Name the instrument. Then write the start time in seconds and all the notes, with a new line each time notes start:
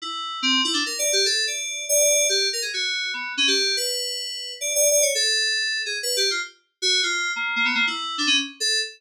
electric piano 2
0.02 E4
0.42 C4
0.65 E4
0.74 D4
0.86 A#4
0.99 D5
1.13 G4
1.26 A4
1.47 D5
1.89 D5
2.29 G4
2.53 A#4
2.62 G#4
2.74 F#4
3.14 B3
3.37 C#4
3.47 G4
3.77 B4
4.61 D5
4.75 D5
4.91 D5
5.02 C#5
5.15 A4
5.86 G#4
6.03 B4
6.17 G4
6.31 F4
6.82 F#4
7.03 F4
7.36 A#3
7.56 A#3
7.65 B3
7.75 A#3
7.87 E4
8.18 D4
8.27 C#4
8.60 A4